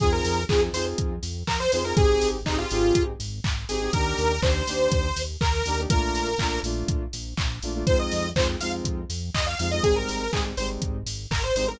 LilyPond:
<<
  \new Staff \with { instrumentName = "Lead 2 (sawtooth)" } { \time 4/4 \key f \dorian \tempo 4 = 122 aes'16 bes'8. aes'16 r16 c''16 r4 r16 bes'16 c''16 c''16 bes'16 | aes'8. r16 ees'16 f'4 r4 r16 aes'8 | bes'4 c''2 bes'4 | bes'4. r2 r8 |
c''16 ees''8. c''16 r16 f''16 r4 r16 ees''16 f''16 f''16 ees''16 | aes'16 bes'8. aes'16 r16 c''16 r4 r16 bes'16 c''16 c''16 bes'16 | }
  \new Staff \with { instrumentName = "Lead 2 (sawtooth)" } { \time 4/4 \key f \dorian <c' ees' f' aes'>4 <c' ees' f' aes'>8 <c' ees' f' aes'>2 <c' ees' f' aes'>16 <c' ees' f' aes'>16 | <c' ees' g' aes'>4 <c' ees' g' aes'>8 <c' ees' g' aes'>2 <c' ees' g' aes'>16 <c' ees' g' aes'>16 | <bes d' ees' g'>4 <bes d' ees' g'>8 <bes d' ees' g'>2 <bes d' ees' g'>16 <bes d' ees' g'>16 | <a bes d' f'>4 <a bes d' f'>8 <a bes d' f'>2 <a bes d' f'>16 <a bes d' f'>16 |
<aes c' ees' f'>4 <aes c' ees' f'>8 <aes c' ees' f'>2 <aes c' ees' f'>16 <aes c' ees' f'>16 | <g aes c' ees'>4 <g aes c' ees'>8 <g aes c' ees'>2 <g aes c' ees'>16 <g aes c' ees'>16 | }
  \new Staff \with { instrumentName = "Synth Bass 1" } { \clef bass \time 4/4 \key f \dorian f,8 f,8 f,8 f,8 f,8 f,8 f,8 f,8 | aes,,8 aes,,8 aes,,8 aes,,8 aes,,8 aes,,8 aes,,8 aes,,8 | ees,8 ees,8 ees,8 ees,8 ees,8 ees,8 ees,8 ees,8 | bes,,8 bes,,8 bes,,8 bes,,8 bes,,8 bes,,8 bes,,8 bes,,8 |
f,8 f,8 f,8 f,8 f,8 f,8 f,8 f,8 | aes,,8 aes,,8 aes,,8 aes,,8 aes,,8 aes,,8 aes,,8 aes,,8 | }
  \new DrumStaff \with { instrumentName = "Drums" } \drummode { \time 4/4 <hh bd>8 hho8 <hc bd>8 hho8 <hh bd>8 hho8 <hc bd>8 hho8 | <hh bd>8 hho8 <hc bd>8 hho8 <hh bd>8 hho8 <hc bd>8 hho8 | <hh bd>8 hho8 <hc bd>8 hho8 <hh bd>8 hho8 <hc bd>8 hho8 | <hh bd>8 hho8 <hc bd>8 hho8 <hh bd>8 hho8 <hc bd>8 hho8 |
<hh bd>8 hho8 <hc bd>8 hho8 <hh bd>8 hho8 <hc bd>8 hho8 | <hh bd>8 hho8 <hc bd>8 hho8 <hh bd>8 hho8 <hc bd>8 hho8 | }
>>